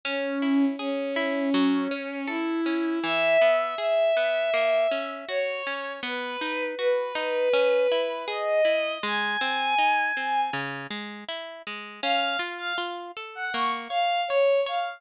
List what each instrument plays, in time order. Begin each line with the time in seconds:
0.05 violin C#4, orchestral harp C#4
0.42 orchestral harp E4
0.79 violin C#4, orchestral harp G#4
1.16 orchestral harp E4
1.54 orchestral harp F#3
1.91 orchestral harp C#4
2.27 violin E4, orchestral harp A4
2.66 orchestral harp C#4
3.02 orchestral harp E3, violin E5
3.41 orchestral harp B3
3.77 orchestral harp G#4, violin E5
4.17 orchestral harp B3
4.54 orchestral harp A#3
4.91 orchestral harp C#4
5.28 orchestral harp F#4, violin C#5
5.67 orchestral harp C#4
6.03 orchestral harp B3, violin B4
6.41 orchestral harp D#4
6.78 orchestral harp F#4, violin B4
7.15 orchestral harp D#4
7.53 orchestral harp C#4
7.92 orchestral harp E4
8.27 orchestral harp G#4, violin D#5
8.65 orchestral harp E4
9.03 orchestral harp G#3, violin G#5
9.41 orchestral harp C4
9.78 orchestral harp D#4
10.17 orchestral harp C4
10.53 orchestral harp C#3
10.90 orchestral harp G#3
11.28 orchestral harp E4
11.67 orchestral harp G#3
12.03 orchestral harp C#4, violin F5
12.39 orchestral harp F4
12.58 violin F5
12.78 orchestral harp F4
13.17 orchestral harp A4
13.35 violin F#5
13.54 orchestral harp A#3, violin C#6
13.89 orchestral harp C#5, violin F5
14.28 violin C#5, orchestral harp C#5
14.66 orchestral harp C#5, violin F5